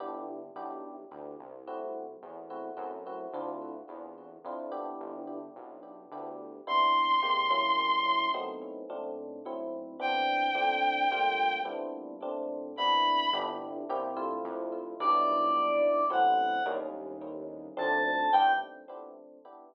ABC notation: X:1
M:3/4
L:1/8
Q:1/4=108
K:Gmix
V:1 name="Lead 1 (square)"
z6 | z6 | z6 | z6 |
[K:Cmix] z6 | z6 | z6 | z6 |
[K:Gmix] z6 | d4 ^f2 | z4 a2 | g2 z4 |]
V:2 name="Violin"
z6 | z6 | z6 | z6 |
[K:Cmix] c'6 | z6 | g6 | z4 =b2 |
[K:Gmix] z6 | z6 | z6 | z6 |]
V:3 name="Electric Piano 1"
[B,DEG]2 [B,DEG]4 | [A,CE^F]3 [A,CEF] [A,CEF] [A,CEF] | [CDEF]4 [CDEF] [B,DEG]- | [B,DEG]4 [B,DEG]2 |
[K:Cmix] [C,=B,DE]2 [C,_A,_B,G] [^F,^A,^CE]3 | [^F,A,=B,C^D]2 [_B,,A,C=D]2 [A,,F,CE]2 | [E,=B,CD]2 [F,A,CD]2 [G,A,_B,F]2 | [G,=B,CDE]2 [_B,,A,CD]2 [C,=B,DE]2 |
[K:Gmix] [B,DEG]2 [_B,CEG] [A,CEF]3 | [G,B,DE]4 [^F,A,CE]2 | [G,_B,_D_E]4 [F,A,C=D]2 | [B,DEG]2 z4 |]
V:4 name="Synth Bass 1" clef=bass
G,,,2 B,,,2 D,, C,,- | C,,2 E,,2 ^F,,2 | D,,2 E,,2 F,,2 | G,,,2 B,,,2 D,,2 |
[K:Cmix] z6 | z6 | z6 | z6 |
[K:Gmix] G,,,2 C,,2 F,,2 | B,,,4 A,,,2 | _E,,4 D,,2 | G,,2 z4 |]